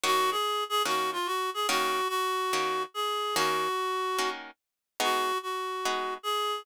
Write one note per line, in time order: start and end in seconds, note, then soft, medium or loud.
0.04 0.36 D#3 loud
0.04 0.36 A#3 loud
0.04 0.36 C#4 loud
0.04 0.36 F#4 loud
0.04 0.30 F#4 medium
0.31 0.64 G#4 medium
0.69 0.82 G#4 medium
0.85 1.18 D#3 medium
0.85 1.18 A#3 medium
0.85 1.18 C#4 medium
0.85 1.18 F#4 medium
0.85 1.10 F#4 medium
1.13 1.27 F4 medium
1.26 1.50 F#4 medium
1.54 1.67 G#4 medium
1.69 2.01 D#3 loud
1.69 2.01 A#3 loud
1.69 2.01 C#4 loud
1.69 2.01 F#4 loud
1.69 2.08 F#4 medium
2.09 2.83 F#4 medium
2.53 2.85 D#3 medium
2.53 2.85 A#3 medium
2.53 2.85 C#4 loud
2.53 2.85 F#4 medium
2.94 3.35 G#4 medium
3.36 3.68 D#3 loud
3.36 3.68 A#3 loud
3.36 3.68 C#4 loud
3.36 4.30 F#4 medium
3.36 3.68 F#4 loud
4.19 4.51 D#3 medium
4.19 4.51 A#3 medium
4.19 4.51 C#4 medium
4.19 4.51 F#4 medium
5.00 5.32 G#3 loud
5.00 5.32 B3 loud
5.00 5.32 D#4 loud
5.00 5.32 F#4 loud
5.00 5.38 F#4 medium
5.43 6.14 F#4 medium
5.85 6.18 G#3 medium
5.85 6.18 B3 medium
5.85 6.18 D#4 medium
5.85 6.18 F#4 loud
6.23 6.62 G#4 medium